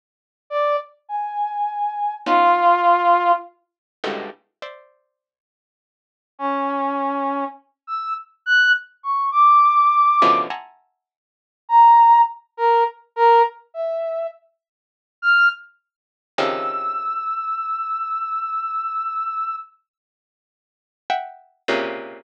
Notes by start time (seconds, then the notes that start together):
0.50 D5
1.09 G#5
2.26 B3 C#4 D#4 F4
4.04 G2 G#2 A2 B2 C#3 D3
4.62 C5 D5 E5
6.39 C#4
7.87 E6
8.46 F#6
9.03 C#6
9.32 D6
10.22 B2 C#3 D3 E3 F3
10.50 E5 F#5 G#5 A5 A#5 C6
11.69 A#5
12.57 A#4
13.16 A#4
13.74 E5
15.22 F6
16.38 C3 C#3 D#3 F3 E6
21.10 E5 F#5 G5
21.68 A#2 C3 C#3